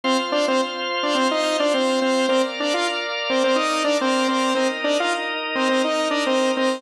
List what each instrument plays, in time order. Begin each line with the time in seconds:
0.04 lead 2 (sawtooth) C4 C5, drawbar organ F4 C5 F5
0.32 lead 2 (sawtooth) D4 D5
0.48 lead 2 (sawtooth) C4 C5
1.03 lead 2 (sawtooth) D4 D5
1.15 lead 2 (sawtooth) C4 C5
1.31 lead 2 (sawtooth) D#4 D#5
1.60 lead 2 (sawtooth) D4 D5
1.74 lead 2 (sawtooth) C4 C5
2.02 lead 2 (sawtooth) C4 C5
2.28 lead 2 (sawtooth) C4 C5, drawbar organ A#4 D5 F5
2.60 lead 2 (sawtooth) D4 D5
2.74 lead 2 (sawtooth) F4 F5
3.30 lead 2 (sawtooth) C4 C5
3.44 lead 2 (sawtooth) C4 C5
3.56 lead 2 (sawtooth) D#4 D#5
3.84 lead 2 (sawtooth) D4 D5
4.01 lead 2 (sawtooth) C4 C5
4.28 lead 2 (sawtooth) C4 C5
4.54 lead 2 (sawtooth) C4 C5, drawbar organ D#4 A#4 D#5
4.84 lead 2 (sawtooth) D4 D5
5.00 lead 2 (sawtooth) F4 F5
5.55 lead 2 (sawtooth) C4 C5
5.69 lead 2 (sawtooth) C4 C5
5.84 lead 2 (sawtooth) D#4 D#5
6.10 lead 2 (sawtooth) D4 D5
6.26 lead 2 (sawtooth) C4 C5
6.57 lead 2 (sawtooth) C4 C5